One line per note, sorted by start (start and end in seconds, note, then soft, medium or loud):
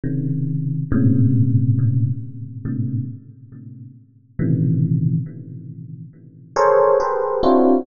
0.03 0.82 C3 medium
0.03 0.82 C#3 medium
0.03 0.82 D#3 medium
0.92 2.09 G#2 loud
0.92 2.09 A2 loud
0.92 2.09 A#2 loud
0.92 2.09 C3 loud
0.92 2.09 C#3 loud
2.65 3.04 G#2 medium
2.65 3.04 A2 medium
2.65 3.04 A#2 medium
2.65 3.04 C3 medium
2.65 3.04 D3 medium
4.39 5.17 A2 medium
4.39 5.17 B2 medium
4.39 5.17 C3 medium
4.39 5.17 C#3 medium
4.39 5.17 D#3 medium
4.39 5.17 E3 medium
6.56 6.95 G#4 medium
6.56 6.95 A4 medium
6.56 6.95 A#4 medium
6.56 6.95 C5 medium
6.56 6.95 C#5 medium
7.00 7.39 G4 medium
7.00 7.39 G#4 medium
7.00 7.39 A4 medium
7.00 7.39 A#4 medium
7.00 7.39 B4 medium
7.00 7.39 C5 medium
7.43 7.82 C4 medium
7.43 7.82 D4 medium
7.43 7.82 E4 medium
7.43 7.82 F4 medium
7.43 7.82 F#4 medium